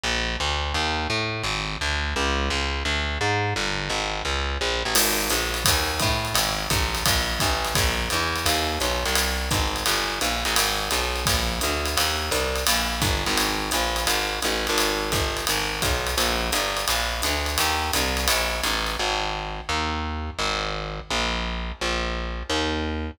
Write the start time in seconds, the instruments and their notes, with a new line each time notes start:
0.04 electric bass (finger) A#1
0.40 electric bass (finger) D2
0.74 electric bass (finger) D#2
1.10 electric bass (finger) A2
1.43 electric bass (finger) G#1
1.81 electric bass (finger) D2
2.16 electric bass (finger) C#2
2.50 electric bass (finger) C#2
2.85 electric bass (finger) D2
3.21 electric bass (finger) G#2
3.56 electric bass (finger) G1
3.89 electric bass (finger) G#1
4.25 electric bass (finger) C#2
4.61 electric bass (finger) A#1
4.85 electric bass (finger) A1
4.95 electric bass (finger) G#1, crash, ride
5.30 electric bass (finger) A#1, hi-hat pedal, ride
5.54 ride
5.65 electric bass (finger) D#2, kick, ride
5.99 electric bass (finger) A2, kick, hi-hat pedal, ride
6.25 ride
6.34 electric bass (finger) G#1, ride
6.70 electric bass (finger) A1, kick, hi-hat pedal, ride
6.95 ride
7.06 electric bass (finger) A#1, kick, ride
7.40 electric bass (finger) A1, kick, hi-hat pedal, ride
7.65 ride
7.75 electric bass (finger) A#1, kick, ride
8.10 electric bass (finger) E2, hi-hat pedal, ride
8.36 ride
8.46 electric bass (finger) D#2, ride
8.80 electric bass (finger) B1, hi-hat pedal, ride
9.05 electric bass (finger) C2, ride
9.15 ride
9.51 electric bass (finger) G#1, kick, hi-hat pedal, ride
9.76 ride
9.86 electric bass (finger) G1, ride
10.21 electric bass (finger) A#1, hi-hat pedal, ride
10.45 electric bass (finger) A1, ride
10.56 electric bass (finger) G#1, ride
10.91 electric bass (finger) B1, hi-hat pedal, ride
11.16 ride
11.26 electric bass (finger) A#1, kick, ride
11.61 electric bass (finger) D2, hi-hat pedal, ride
11.85 ride
11.97 electric bass (finger) D#2, ride
12.31 electric bass (finger) C2, hi-hat pedal, ride
12.55 ride
12.67 electric bass (finger) A#1, ride
13.02 electric bass (finger) G1, kick, hi-hat pedal, ride
13.26 electric bass (finger) G#1, ride
13.37 ride
13.71 electric bass (finger) A#1, hi-hat pedal, ride
13.96 ride
14.07 electric bass (finger) G#1, ride
14.42 electric bass (finger) A1, hi-hat pedal, ride
14.67 electric bass (finger) G#1, ride
14.78 ride
15.12 electric bass (finger) G1, kick, hi-hat pedal, ride
15.37 ride
15.47 electric bass (finger) G#1, ride
15.82 electric bass (finger) B1, kick, hi-hat pedal, ride
16.07 ride
16.17 electric bass (finger) A#1, ride
16.52 electric bass (finger) G1, hi-hat pedal, ride
16.77 ride
16.88 electric bass (finger) A#1, ride
17.22 electric bass (finger) D2, hi-hat pedal, ride
17.46 ride
17.58 electric bass (finger) D#2, ride
17.93 electric bass (finger) C2, hi-hat pedal, ride
18.17 ride
18.28 electric bass (finger) A#1, ride
18.63 electric bass (finger) A1, hi-hat pedal, ride
18.87 ride
18.99 electric bass (finger) G#1
19.69 electric bass (finger) D#2
20.39 electric bass (finger) G#1
21.10 electric bass (finger) A#1
21.81 electric bass (finger) A#1
22.49 electric bass (finger) D#2